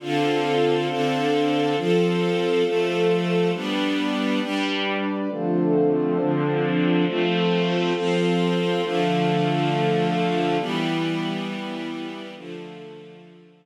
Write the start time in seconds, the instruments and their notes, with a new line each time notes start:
0.00 string ensemble 1 D3 C4 F4 A4, pad 2 (warm) D4 A4 C5 F5
0.88 string ensemble 1 D3 C4 D4 A4
1.75 string ensemble 1 F3 C4 A4, pad 2 (warm) F4 A4 C5
2.64 string ensemble 1 F3 A3 A4
3.53 string ensemble 1 G3 B3 D4, pad 2 (warm) G4 B4 D5
4.41 string ensemble 1 G3 D4 G4
5.29 string ensemble 1 D3 F3 A3 C4, pad 2 (warm) D4 F4 A4 C5
6.18 string ensemble 1 D3 F3 C4 D4
7.06 string ensemble 1 F3 A3 C4, pad 2 (warm) F4 A4 C5
7.94 string ensemble 1 F3 C4 F4
8.82 string ensemble 1 D3 F3 A3, pad 2 (warm) D4 A4 F5
10.58 string ensemble 1 E3 G3 B3, pad 2 (warm) E4 G4 B4
12.35 string ensemble 1 D3 F3 A3, pad 2 (warm) D4 F4 A4